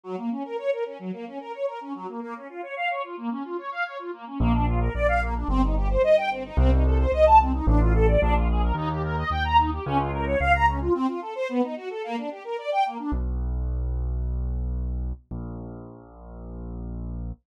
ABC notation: X:1
M:4/4
L:1/16
Q:1/4=110
K:Bbm
V:1 name="String Ensemble 1"
G, B, D B d B D G, B, D B d B D G, B, | B, D F d f d F B, D F d f d F B, D | [K:Bb] B, D F B d f B, D C E G c e g C E | C E A c e a C E D F A d D F _A B |
E G B e g b E G _D F B _d f b D F | C F A c =B, ^D ^F A _B, =D G B d g B, D | [K:B] z16 | z16 |]
V:2 name="Acoustic Grand Piano" clef=bass
z16 | z16 | [K:Bb] B,,,4 B,,,4 G,,,4 G,,,4 | C,,4 C,,4 A,,,4 B,,,4 |
E,,4 E,,4 _D,,4 D,,4 | z16 | [K:B] B,,,16 | A,,,16 |]